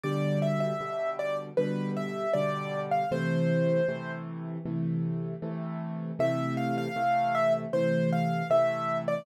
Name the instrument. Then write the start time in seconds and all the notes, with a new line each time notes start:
acoustic grand piano
0.04 B2 D3 G3 D5
0.42 E5
0.60 E5
0.81 B2 D3 G3
1.19 D5
1.57 B2 D3 G3 B4
1.97 E5
2.33 B2 D3 G3 D5
2.92 F5
3.11 C3 E3 A3 C5
3.88 C3 E3 A3
4.66 C3 E3 A3
5.42 C3 E3 A3
6.19 C3 E3 A3 E5
6.57 F5
6.78 F5
6.96 C3 E3 A3
7.35 E5
7.73 C3 E3 A3 C5
8.13 F5
8.50 C3 E3 A3 E5
9.08 D5